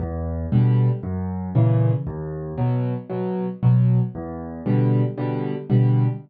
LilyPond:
\new Staff { \clef bass \time 4/4 \key e \minor \tempo 4 = 116 e,4 <b, d g>4 fis,4 <ais, cis e>4 | dis,4 <b, fis>4 <b, fis>4 <b, fis>4 | e,4 <b, d g>4 <b, d g>4 <b, d g>4 | }